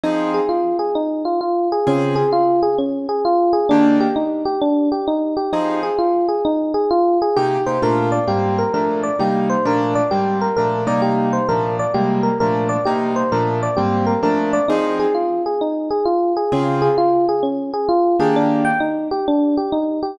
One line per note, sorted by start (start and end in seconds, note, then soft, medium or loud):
0.04 0.40 F3 medium
0.04 0.40 C4 medium
0.04 0.31 D#4 medium
0.04 0.40 D#4 medium
0.04 0.40 G#4 medium
0.34 0.49 G#4 medium
0.49 0.76 F4 medium
0.79 0.94 G#4 medium
0.95 1.23 D#4 medium
1.25 1.40 F4 medium
1.41 1.68 F4 medium
1.72 1.87 G#4 medium
1.87 2.23 C#3 medium
1.87 2.23 C4 medium
1.87 2.15 C#4 medium
1.87 2.23 F4 medium
1.87 2.23 G#4 medium
2.16 2.30 G#4 medium
2.33 2.60 F4 medium
2.63 2.77 G#4 medium
2.78 3.06 C#4 medium
3.09 3.23 G#4 medium
3.25 3.52 F4 medium
3.53 3.68 G#4 medium
3.69 4.07 D#3 loud
3.69 4.07 A#3 loud
3.69 3.97 D4 medium
3.69 4.07 D4 medium
3.69 4.07 G4 medium
4.00 4.15 G4 medium
4.16 4.43 D#4 medium
4.45 4.60 G4 medium
4.62 4.89 D4 medium
4.92 5.06 G4 medium
5.08 5.35 D#4 medium
5.37 5.51 G4 medium
5.53 5.89 F3 medium
5.53 5.89 C4 medium
5.53 5.80 D#4 medium
5.53 5.89 D#4 medium
5.53 5.89 G#4 medium
5.83 5.98 G#4 medium
5.99 6.26 F4 medium
6.29 6.43 G#4 medium
6.45 6.72 D#4 medium
6.74 6.89 G#4 medium
6.91 7.18 F4 medium
7.22 7.36 G#4 medium
7.36 7.58 C3 medium
7.36 7.58 A#3 medium
7.36 7.58 D#4 medium
7.36 7.64 G4 medium
7.36 7.58 G4 medium
7.66 7.78 C3 medium
7.66 7.78 A#3 medium
7.66 7.78 D#4 medium
7.66 7.78 G4 medium
7.66 7.81 C5 medium
7.82 8.19 A#2 medium
7.82 8.19 A3 medium
7.82 8.19 D4 medium
7.82 8.19 F4 medium
7.82 8.10 A#4 medium
8.12 8.27 D5 medium
8.27 8.64 G#2 medium
8.27 8.64 G3 medium
8.27 8.64 A#3 medium
8.27 8.64 C4 medium
8.27 8.55 G4 medium
8.58 8.73 A#4 medium
8.74 9.10 A#2 medium
8.74 9.10 F3 medium
8.74 9.10 A3 medium
8.74 9.10 D4 medium
8.74 9.01 A#4 medium
9.03 9.18 D5 medium
9.19 9.56 C3 medium
9.19 9.56 G3 medium
9.19 9.56 A#3 medium
9.19 9.56 D#4 medium
9.19 9.48 G4 medium
9.50 9.64 C5 medium
9.65 10.02 A#2 medium
9.65 10.02 F3 medium
9.65 10.02 A3 medium
9.65 10.02 D4 loud
9.65 9.94 A#4 medium
9.95 10.10 D5 medium
10.11 10.48 G#2 medium
10.11 10.48 G3 medium
10.11 10.48 A#3 medium
10.11 10.48 C4 medium
10.11 10.38 G4 medium
10.41 10.56 A#4 medium
10.57 10.86 A#2 medium
10.57 10.86 F3 medium
10.57 10.86 A3 medium
10.57 10.86 D4 medium
10.57 10.84 A#4 medium
10.87 11.39 C3 medium
10.87 11.39 G3 medium
10.87 11.39 A#3 medium
10.87 11.39 D#4 medium
10.87 11.02 D5 medium
11.02 11.29 G4 medium
11.33 11.48 C5 medium
11.49 11.85 A#2 medium
11.49 11.85 F3 medium
11.49 11.85 A3 medium
11.49 11.85 D4 medium
11.49 11.76 A#4 medium
11.79 11.94 D5 medium
11.94 12.31 C3 medium
11.94 12.31 G3 medium
11.94 12.31 G#3 medium
11.94 12.31 A#3 medium
11.94 12.22 G4 medium
12.23 12.38 A#4 medium
12.40 12.77 A#2 medium
12.40 12.77 F3 medium
12.40 12.77 A3 medium
12.40 12.77 D4 medium
12.40 12.68 A#4 medium
12.69 12.84 D5 medium
12.85 13.23 C3 medium
12.85 13.23 G3 medium
12.85 13.23 A#3 medium
12.85 13.23 D#4 medium
12.85 13.13 G4 medium
13.16 13.31 C5 medium
13.32 13.68 A#2 medium
13.32 13.68 F3 medium
13.32 13.68 A3 medium
13.32 13.68 D4 medium
13.32 13.60 A#4 medium
13.63 13.77 D5 medium
13.77 14.14 G#2 medium
13.77 14.14 G3 medium
13.77 14.14 A#3 medium
13.77 14.14 C4 medium
13.77 14.04 G4 medium
14.07 14.21 A#4 medium
14.23 14.59 A#2 medium
14.23 14.59 F3 medium
14.23 14.59 A3 medium
14.23 14.59 D4 medium
14.23 14.51 A#4 medium
14.53 14.68 D5 medium
14.68 15.06 F3 medium
14.68 15.06 C4 medium
14.68 14.96 D#4 medium
14.68 15.06 D#4 medium
14.68 15.06 G#4 medium
15.00 15.14 G#4 medium
15.15 15.42 F4 medium
15.46 15.61 G#4 medium
15.61 15.89 D#4 medium
15.91 16.05 G#4 medium
16.05 16.33 F4 medium
16.37 16.51 G#4 medium
16.52 16.88 C#3 medium
16.52 16.88 C4 medium
16.52 16.80 C#4 medium
16.52 16.88 F4 medium
16.52 16.88 G#4 medium
16.82 16.96 G#4 medium
16.98 17.25 F4 medium
17.29 17.43 G#4 medium
17.43 17.70 C#4 medium
17.73 17.88 G#4 medium
17.89 18.16 F4 medium
18.20 18.72 D#3 medium
18.20 18.72 A#3 medium
18.20 18.72 D4 medium
18.20 18.72 G4 medium
18.20 18.35 G#4 medium
18.36 18.64 D4 medium
18.65 18.79 G5 medium
18.80 19.08 D#4 medium
19.11 19.26 G4 medium
19.28 19.55 D4 medium
19.57 19.72 G4 medium
19.72 20.00 D#4 medium
20.03 20.17 G4 medium